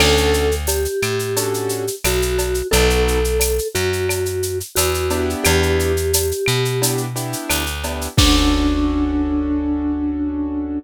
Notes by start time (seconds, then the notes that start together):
0.00 D2 C#4 D4 F#4 A4, crash, cowbell, claves
0.17 shaker
0.34 shaker
0.51 shaker
0.67 G4, tambourine, cowbell, shaker
0.85 shaker
1.02 A2, claves, shaker
1.19 shaker
1.37 C#4 D4 F#4 A4, cowbell, shaker
1.54 shaker
1.69 shaker
1.87 shaker
2.04 B1 F#4, tambourine, cowbell, claves, shaker
2.22 shaker
2.38 cowbell, shaker
2.54 shaker
2.71 B1 B3 D#4 F#4 A4, cowbell, shaker
2.90 shaker
3.08 shaker
3.24 shaker
3.40 tambourine, cowbell, claves, shaker
3.59 shaker
3.75 F#2 F#4, shaker
3.93 shaker
4.09 cowbell, claves, shaker
4.26 shaker
4.43 shaker
4.60 shaker
4.75 E2 F#4, tambourine, cowbell, shaker
4.94 shaker
5.10 B3 D4 E4 G4, cowbell, shaker
5.30 shaker
5.44 E2 G4, cowbell, claves, shaker
5.63 shaker
5.79 shaker
5.97 shaker
6.13 tambourine, cowbell, shaker
6.31 shaker
6.46 B2, claves, shaker
6.65 shaker
6.82 B3 D4 E4 G4, cowbell, shaker
6.97 shaker
7.16 B3 D4 E4 G4, shaker
7.33 shaker
7.49 D2, tambourine, cowbell, claves, shaker
7.67 shaker
7.83 B3 D4 E4 G4, cowbell, shaker
8.01 shaker
8.17 D2 C#4 D4 F#4 A4, kick, crash